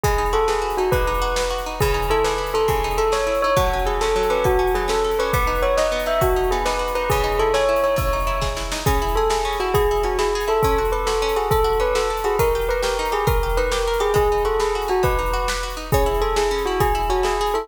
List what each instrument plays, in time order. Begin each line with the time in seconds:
0.03 pizzicato strings G#3, tubular bells G#4, kick, closed hi-hat
0.18 pizzicato strings D#4
0.26 closed hi-hat
0.33 pizzicato strings F#4, tubular bells A4
0.48 tubular bells G#4, pizzicato strings B4, snare
0.62 pizzicato strings F#4
0.70 closed hi-hat
0.77 pizzicato strings D#4, tubular bells F#4
0.92 pizzicato strings G#3, tubular bells B4, kick, closed hi-hat
1.07 pizzicato strings D#4
1.14 closed hi-hat
1.22 pizzicato strings F#4
1.36 pizzicato strings B4, snare
1.50 pizzicato strings F#4
1.58 closed hi-hat
1.66 pizzicato strings D#4
1.80 pizzicato strings C#3, tubular bells G#4, kick, closed hi-hat
1.94 pizzicato strings D#4
2.02 closed hi-hat
2.10 pizzicato strings E4, tubular bells A4
2.24 pizzicato strings G#4, tubular bells B4, snare
2.38 pizzicato strings E4
2.47 closed hi-hat
2.54 pizzicato strings D#4, tubular bells A4
2.68 pizzicato strings C#3, tubular bells G#4, kick, closed hi-hat
2.84 pizzicato strings D#4
2.91 closed hi-hat
2.98 pizzicato strings E4, tubular bells A4
3.12 pizzicato strings G#4, tubular bells C#5, snare
3.27 pizzicato strings E4
3.35 closed hi-hat
3.42 pizzicato strings D#4, tubular bells C#5
3.56 pizzicato strings F#3, tubular bells F#4, kick, closed hi-hat
3.73 pizzicato strings C#4
3.79 closed hi-hat
3.86 tubular bells G#4, pizzicato strings A4
4.01 pizzicato strings C#4, tubular bells A4, snare
4.16 pizzicato strings F#3
4.23 closed hi-hat
4.30 pizzicato strings C#4, tubular bells B4
4.44 tubular bells F#4, pizzicato strings A4, kick, closed hi-hat
4.59 pizzicato strings C#4
4.67 closed hi-hat
4.75 pizzicato strings F#3, tubular bells G#4
4.88 pizzicato strings C#4, tubular bells A4, snare
5.04 pizzicato strings A4
5.11 closed hi-hat
5.19 pizzicato strings C#4, tubular bells B4
5.33 pizzicato strings B3, tubular bells B4, kick, closed hi-hat
5.47 pizzicato strings D#4
5.55 closed hi-hat
5.62 pizzicato strings F#4, tubular bells C#5
5.77 pizzicato strings D#4, tubular bells D#5, snare
5.92 pizzicato strings B3
6.00 closed hi-hat
6.06 pizzicato strings D#4, tubular bells E5
6.21 pizzicato strings F#4, tubular bells F#4, kick, closed hi-hat
6.36 pizzicato strings D#4
6.44 closed hi-hat
6.51 pizzicato strings B3, tubular bells G#4
6.65 pizzicato strings D#4, tubular bells B4, snare
6.79 pizzicato strings F#4
6.88 closed hi-hat
6.95 pizzicato strings D#4, tubular bells B4
7.10 pizzicato strings C#3, tubular bells G#4, kick, closed hi-hat
7.24 pizzicato strings D#4
7.32 closed hi-hat
7.39 pizzicato strings E4, tubular bells A4
7.54 pizzicato strings G#4, tubular bells C#5, snare
7.69 pizzicato strings E4
7.76 closed hi-hat
7.84 pizzicato strings D#4, tubular bells C#5
7.96 pizzicato strings C#3, tubular bells C#5, kick, closed hi-hat
8.13 pizzicato strings D#4
8.20 closed hi-hat
8.27 pizzicato strings E4
8.41 pizzicato strings G#4, kick, snare
8.56 pizzicato strings E4, snare
8.72 pizzicato strings D#4, snare
8.86 pizzicato strings C#4, tubular bells G#4, kick, closed hi-hat
9.02 pizzicato strings E4
9.08 closed hi-hat
9.16 pizzicato strings G#4, tubular bells A4
9.30 pizzicato strings E4, tubular bells G#4, snare
9.45 pizzicato strings C#4
9.53 closed hi-hat
9.60 pizzicato strings E4, tubular bells F#4
9.74 tubular bells G#4, pizzicato strings G#4, kick, closed hi-hat
9.91 pizzicato strings E4
9.97 closed hi-hat
10.03 pizzicato strings C#4, tubular bells F#4
10.19 pizzicato strings E4, tubular bells G#4, snare
10.35 pizzicato strings G#4
10.41 closed hi-hat
10.48 pizzicato strings E4, tubular bells A4
10.63 pizzicato strings C#4, tubular bells A4, kick, closed hi-hat
10.78 pizzicato strings F#4
10.85 closed hi-hat
10.92 pizzicato strings A4, tubular bells B4
11.06 pizzicato strings F#4, tubular bells A4, snare
11.22 pizzicato strings C#4
11.29 closed hi-hat
11.36 pizzicato strings F#4, tubular bells G#4
11.51 tubular bells A4, pizzicato strings A4, kick, closed hi-hat
11.64 pizzicato strings F#4
11.73 closed hi-hat
11.80 pizzicato strings C#4, tubular bells B4
11.95 pizzicato strings F#4, tubular bells A4, snare
12.10 pizzicato strings A4
12.17 closed hi-hat
12.24 pizzicato strings F#4, tubular bells G#4
12.39 pizzicato strings D#4, tubular bells A#4, kick, closed hi-hat
12.55 pizzicato strings G4
12.61 closed hi-hat
12.69 pizzicato strings A#4, tubular bells B4
12.82 pizzicato strings G4, tubular bells A#4, snare
12.99 pizzicato strings D#4
13.05 closed hi-hat
13.12 pizzicato strings G4, tubular bells G#4
13.27 pizzicato strings A#4, tubular bells A#4, kick, closed hi-hat
13.43 pizzicato strings G4
13.49 closed hi-hat
13.57 pizzicato strings D#4, tubular bells B4
13.71 pizzicato strings G4, tubular bells A#4, snare
13.87 pizzicato strings A#4
13.94 closed hi-hat
14.00 pizzicato strings G4, tubular bells G#4
14.14 pizzicato strings G#3, tubular bells G#4, kick, closed hi-hat
14.32 pizzicato strings D#4
14.38 closed hi-hat
14.45 pizzicato strings F#4, tubular bells A4
14.60 tubular bells G#4, pizzicato strings B4, snare
14.75 pizzicato strings F#4
14.82 closed hi-hat
14.88 pizzicato strings D#4, tubular bells F#4
15.03 pizzicato strings G#3, tubular bells B4, kick, closed hi-hat
15.19 pizzicato strings D#4
15.26 closed hi-hat
15.33 pizzicato strings F#4
15.48 pizzicato strings B4, snare
15.63 pizzicato strings F#4
15.70 closed hi-hat
15.77 pizzicato strings D#4
15.92 pizzicato strings C#4, tubular bells G#4, kick, closed hi-hat
16.06 pizzicato strings E4
16.14 closed hi-hat
16.21 pizzicato strings G#4, tubular bells A4
16.36 pizzicato strings E4, tubular bells G#4, snare
16.51 pizzicato strings C#4
16.58 closed hi-hat
16.66 pizzicato strings E4, tubular bells F#4
16.80 pizzicato strings G#4, tubular bells G#4, kick, closed hi-hat
16.95 pizzicato strings E4
17.02 closed hi-hat
17.10 pizzicato strings C#4, tubular bells F#4
17.23 pizzicato strings E4, tubular bells G#4, snare
17.41 pizzicato strings G#4
17.47 closed hi-hat
17.54 pizzicato strings E4, tubular bells A4